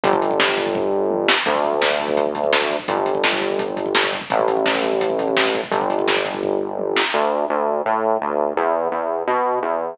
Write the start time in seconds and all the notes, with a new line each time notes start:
0.03 G1, kick, closed hi-hat
0.13 kick
0.22 kick, closed hi-hat
0.31 kick
0.40 kick, snare
0.49 kick
0.57 kick, closed hi-hat
0.66 kick
0.75 kick, floor tom
1.11 high tom
1.28 snare
1.46 D2, kick, closed hi-hat
1.55 kick
1.64 kick, closed hi-hat
1.73 kick
1.82 kick, snare
1.91 kick
1.99 kick, closed hi-hat
2.08 kick
2.17 kick, closed hi-hat
2.26 kick
2.35 kick, closed hi-hat
2.44 kick
2.53 kick, snare
2.62 kick
2.70 kick, closed hi-hat
2.79 kick
2.88 G1, kick, closed hi-hat
2.97 kick
3.06 kick, closed hi-hat
3.15 kick
3.24 kick, snare
3.33 kick
3.41 kick, closed hi-hat
3.50 kick
3.59 kick, closed hi-hat
3.68 kick
3.77 kick, closed hi-hat
3.86 kick
3.95 kick, snare
4.04 kick
4.12 kick, closed hi-hat
4.21 kick
4.30 A1, kick, closed hi-hat
4.39 kick
4.48 kick, closed hi-hat
4.57 kick
4.66 kick, snare
4.75 kick
4.83 kick, closed hi-hat
4.92 kick
5.01 kick, closed hi-hat
5.10 kick
5.19 kick, closed hi-hat
5.28 kick
5.37 kick, snare
5.45 kick
5.54 kick, closed hi-hat
5.63 kick
5.71 G1, kick, closed hi-hat
5.81 kick
5.90 kick, closed hi-hat
5.99 kick
6.08 kick, snare
6.17 kick
6.25 kick, closed hi-hat
6.34 kick
6.43 kick, floor tom
6.79 high tom
6.96 snare
7.14 D2
7.50 D2
7.86 A2
8.21 D2
8.57 E2
8.91 E2
9.27 B2
9.63 E2